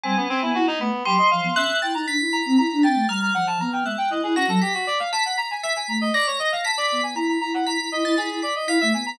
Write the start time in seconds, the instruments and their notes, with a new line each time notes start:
0.03 ocarina G3, clarinet C4, tubular bells G#5
0.17 clarinet B3, ocarina C#4
0.29 clarinet C4
0.42 ocarina B3, clarinet E4
0.55 ocarina E4, clarinet F#4
0.67 clarinet D#4
0.79 ocarina A3, clarinet B3, tubular bells B5
1.05 ocarina F#3, clarinet G4, tubular bells C6
1.18 clarinet D#5
1.31 ocarina F3, clarinet F5
1.44 ocarina B3
1.56 ocarina C#4, clarinet E5, tubular bells F#6
1.82 ocarina E4, clarinet G5, tubular bells A6
1.94 ocarina D#4, clarinet A#5
2.08 ocarina D4, tubular bells B6
2.19 ocarina E4
2.33 clarinet A#5
2.46 ocarina C4
2.58 ocarina E4, clarinet A#5
2.72 ocarina D4
2.83 ocarina C4, clarinet G5, tubular bells A6
2.94 ocarina A3
3.07 ocarina G3, clarinet A#5, tubular bells F6
3.22 clarinet A#5
3.34 ocarina F3, clarinet F#5
3.47 clarinet A5
3.60 ocarina B3, clarinet A#5
3.72 clarinet G5
3.85 ocarina G#3, clarinet E5, tubular bells F#6
3.98 clarinet G5
4.10 ocarina E4, clarinet D#5
4.23 ocarina E4, clarinet G#4
4.36 ocarina C#4, clarinet F#4, tubular bells A#6
4.48 ocarina F#3, clarinet A4
4.61 clarinet G4, tubular bells B6
4.74 clarinet F#4
4.87 clarinet D5
5.00 clarinet F5
5.12 clarinet A5, tubular bells B6
5.25 clarinet F#5
5.38 clarinet A#5, tubular bells B6
5.50 clarinet G#5
5.63 clarinet E5, tubular bells B6
5.76 clarinet G#5
5.88 ocarina A3, clarinet A#5
6.01 clarinet D#5
6.14 clarinet D5, tubular bells A#6
6.27 clarinet C#5
6.39 clarinet D#5
6.52 clarinet F5
6.64 clarinet A5, tubular bells B6
6.78 clarinet D5
6.92 ocarina B3
7.03 clarinet G#5
7.15 ocarina E4, clarinet A#5, tubular bells B6
7.28 clarinet A#5
7.41 ocarina E4, clarinet A#5
7.54 clarinet F#5
7.66 ocarina E4, clarinet A#5, tubular bells B6
7.78 ocarina E4
7.92 ocarina E4, clarinet D#5
8.04 ocarina E4, tubular bells A6
8.17 ocarina E4, clarinet G#4, tubular bells B6
8.30 ocarina E4
8.42 clarinet D5, tubular bells B6
8.56 clarinet D#5
8.67 ocarina E4, clarinet F5, tubular bells B6
8.81 ocarina A3, clarinet E5
8.93 ocarina B3, clarinet G#5
9.06 clarinet A#5